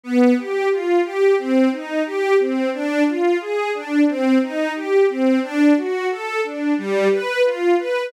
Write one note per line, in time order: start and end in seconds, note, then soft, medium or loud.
0.04 0.34 B3 medium
0.37 0.68 G4 medium
0.71 1.01 F4 medium
1.05 1.35 G4 medium
1.38 1.69 C4 medium
1.72 2.02 D#4 medium
2.06 2.36 G4 medium
2.39 2.70 C4 medium
2.73 3.04 D4 medium
3.07 3.37 F4 medium
3.41 3.71 G#4 medium
3.74 4.05 D4 medium
4.08 4.38 C4 medium
4.42 4.72 D#4 medium
4.75 5.06 G4 medium
5.09 5.39 C4 medium
5.43 5.73 D4 loud
5.77 6.07 F#4 medium
6.10 6.41 A4 medium
6.44 6.74 D4 medium
6.78 7.08 G3 medium
7.11 7.42 B4 medium
7.45 7.75 F4 medium
7.79 8.09 B4 medium